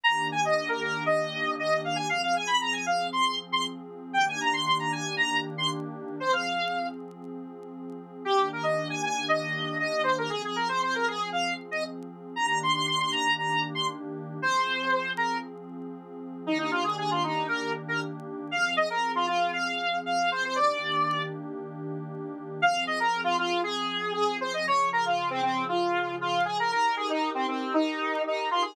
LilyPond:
<<
  \new Staff \with { instrumentName = "Lead 1 (square)" } { \time 4/4 \key f \minor \tempo 4 = 117 bes''8 aes''16 ees''8 bes'16 bes'8 ees''4 ees''8 f''16 aes''16 | f''16 f''16 aes''16 ces'''16 bes''16 aes''16 f''8 c'''8 r16 c'''16 r4 | g''16 aes''16 bes''16 c'''16 c'''16 bes''16 aes''8 bes''8 r16 c'''16 r4 | c''16 f''4~ f''16 r2 r8 |
g'8 bes'16 ees''8 aes''16 aes''8 ees''4 ees''8 c''16 bes'16 | aes'16 aes'16 bes'16 c''16 c''16 bes'16 aes'8 f''8 r16 ees''16 r4 | bes''16 bes''16 c'''16 c'''16 c'''16 c'''16 bes''8 bes''8 r16 c'''16 r4 | c''4. bes'8 r2 |
ees'16 ees'16 f'16 aes'16 aes'16 f'16 ees'8 bes'8 r16 bes'16 r4 | f''8 ees''16 bes'8 f'16 f'8 f''4 f''8 c''16 c''16 | d''4. r2 r8 | f''8 ees''16 bes'8 f'16 f'8 aes'4 aes'8 c''16 ees''16 |
des''8 bes'16 f'8 c'16 c'8 f'4 f'8 aes'16 bes'16 | bes'8 aes'16 ees'8 c'16 c'8 ees'4 ees'8 f'16 aes'16 | }
  \new Staff \with { instrumentName = "Pad 2 (warm)" } { \time 4/4 \key f \minor <ees bes d' g'>1 | <f c' aes'>1 | <ees bes d' g'>1 | <f c' aes'>1 |
<ees bes d' g'>1 | <f c' aes'>1 | <ees bes d' g'>1 | <f c' aes'>1 |
<ees bes d' g'>1 | <f c' aes'>1 | <ees bes d' g'>1 | <f c' aes'>1 |
<des f aes'>1 | <ees' g' bes'>1 | }
>>